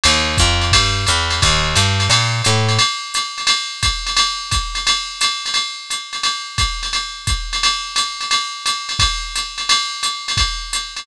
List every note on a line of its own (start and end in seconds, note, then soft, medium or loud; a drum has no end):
0.04 0.38 D#2 medium
0.04 ride loud
0.38 0.72 F2 medium
0.38 kick medium
0.38 hi-hat pedal loud
0.38 ride medium
0.61 ride medium
0.72 1.06 G2 medium
0.72 kick medium
0.72 ride loud
1.07 1.41 E2 medium
1.07 hi-hat pedal loud
1.07 ride medium
1.30 ride medium
1.42 1.75 D#2 loud
1.42 kick medium
1.42 ride loud
1.76 2.09 G2 medium
1.76 hi-hat pedal loud
1.76 ride loud
2.00 ride medium
2.10 2.42 A#2 medium
2.10 ride loud
2.44 2.78 A2 medium
2.44 hi-hat pedal loud
2.44 ride loud
2.69 ride medium
2.79 ride loud
3.14 hi-hat pedal loud
3.14 ride loud
3.38 ride medium
3.47 ride loud
3.83 kick medium
3.83 hi-hat pedal medium
3.83 ride loud
4.07 ride medium
4.17 ride loud
4.51 kick medium
4.51 hi-hat pedal medium
4.51 ride loud
4.75 ride medium
4.87 ride loud
5.21 hi-hat pedal loud
5.21 ride loud
5.46 ride medium
5.54 ride loud
5.90 hi-hat pedal medium
5.90 ride medium
6.13 ride medium
6.23 ride loud
6.58 kick medium
6.58 hi-hat pedal medium
6.58 ride loud
6.83 ride medium
6.93 ride loud
7.27 kick medium
7.27 hi-hat pedal loud
7.27 ride medium
7.53 ride medium
7.63 ride loud
7.96 hi-hat pedal medium
7.96 ride loud
8.21 ride medium
8.31 ride loud
8.66 hi-hat pedal loud
8.66 ride loud
8.89 ride medium
8.99 kick medium
8.99 ride loud
9.36 hi-hat pedal medium
9.36 ride medium
9.58 ride medium
9.69 ride loud
10.03 hi-hat pedal loud
10.03 ride medium
10.28 ride medium
10.37 kick medium
10.37 ride loud
10.73 hi-hat pedal loud
10.73 ride medium
10.97 ride medium